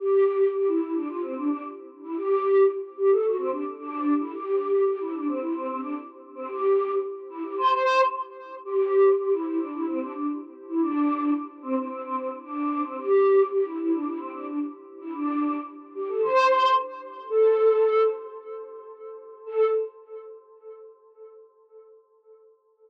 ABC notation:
X:1
M:4/4
L:1/16
Q:1/4=111
K:C
V:1 name="Choir Aahs"
G4 G E E D F C D D z3 E | G4 z2 G A ^F C D z D3 E | G4 G E D C E C C D z3 C | G4 z2 E G c4 z4 |
G4 G E E D E C D D z3 E | D4 z2 C C C C C z D3 C | G4 G E E D E C D D z3 E | D4 z2 G A c4 z4 |
[K:Am] A6 z10 | A4 z12 |]